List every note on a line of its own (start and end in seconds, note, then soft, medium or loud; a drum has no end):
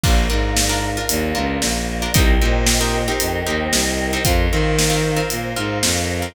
0.04 0.26 A#1 loud
0.04 0.25 D4 loud
0.04 0.25 F4 loud
0.04 0.25 A#4 medium
0.04 2.13 A#4 medium
0.04 2.13 D5 medium
0.04 2.13 F5 medium
0.04 kick loud
0.04 crash loud
0.30 0.97 G#2 medium
0.30 0.61 D4 medium
0.30 0.61 F4 medium
0.30 0.61 A#4 medium
0.56 snare loud
0.69 0.90 D4 loud
0.69 0.90 F4 medium
0.69 0.90 A#4 medium
0.97 1.29 D4 medium
0.97 1.29 F4 medium
0.97 1.29 A#4 medium
1.09 1.32 D#2 loud
1.09 closed hi-hat loud
1.35 1.58 C#2 loud
1.35 1.77 D4 medium
1.35 1.77 F4 medium
1.35 1.77 A#4 medium
1.62 2.07 A#1 loud
1.62 snare loud
2.02 2.13 D4 medium
2.02 2.13 F4 medium
2.02 2.13 A#4 medium
2.14 2.37 C2 loud
2.14 2.35 C4 loud
2.14 2.35 D#4 loud
2.14 2.35 G4 loud
2.14 4.23 A#4 loud
2.14 2.35 A#4 loud
2.14 4.23 C5 medium
2.14 4.23 D#5 medium
2.14 4.23 G5 medium
2.14 kick loud
2.14 closed hi-hat loud
2.41 3.08 A#2 loud
2.41 2.73 C4 medium
2.41 2.73 D#4 medium
2.41 2.73 G4 medium
2.41 2.73 A#4 medium
2.66 snare loud
2.81 3.02 C4 medium
2.81 3.02 D#4 medium
2.81 3.02 G4 medium
2.81 3.02 A#4 medium
3.08 3.39 C4 medium
3.08 3.39 D#4 medium
3.08 3.39 G4 medium
3.08 3.39 A#4 medium
3.20 3.42 F2 loud
3.20 closed hi-hat loud
3.46 3.68 D#2 medium
3.46 3.89 C4 medium
3.46 3.89 D#4 medium
3.46 3.89 G4 medium
3.46 3.89 A#4 medium
3.72 4.17 C2 loud
3.72 snare loud
4.13 4.23 C4 medium
4.13 4.23 D#4 medium
4.13 4.23 G4 medium
4.13 4.23 A#4 medium
4.25 4.47 F2 loud
4.25 4.46 C4 loud
4.25 4.46 F4 loud
4.25 6.33 A#4 medium
4.25 4.46 A#4 medium
4.25 6.33 C5 medium
4.25 6.33 F5 medium
4.25 kick loud
4.25 closed hi-hat loud
4.51 5.18 D#3 loud
4.51 4.84 C4 medium
4.51 4.84 F4 medium
4.51 4.84 A#4 medium
4.79 snare loud
4.90 5.11 C4 medium
4.90 5.11 F4 medium
4.90 5.11 A#4 medium
5.16 5.48 C4 medium
5.16 5.48 F4 medium
5.16 5.48 A#4 medium
5.30 5.53 A#2 medium
5.30 closed hi-hat loud
5.56 5.79 G#2 loud
5.56 5.98 C4 medium
5.56 5.98 F4 loud
5.56 5.98 A#4 medium
5.83 6.28 F2 loud
5.83 snare loud
6.22 6.33 C4 medium
6.22 6.33 F4 medium
6.22 6.33 A#4 medium